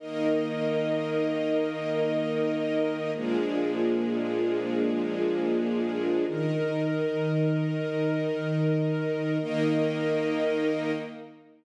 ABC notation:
X:1
M:4/4
L:1/8
Q:1/4=153
K:Eb
V:1 name="String Ensemble 1"
[E,B,E]8- | [E,B,E]8 | [B,,F,A,D]8- | [B,,F,A,D]8 |
[EBe]8- | [EBe]8 | [E,B,E]8 |]
V:2 name="String Ensemble 1"
[EBe]8- | [EBe]8 | [B,DFA]8- | [B,DFA]8 |
[E,EB]8- | [E,EB]8 | [EBe]8 |]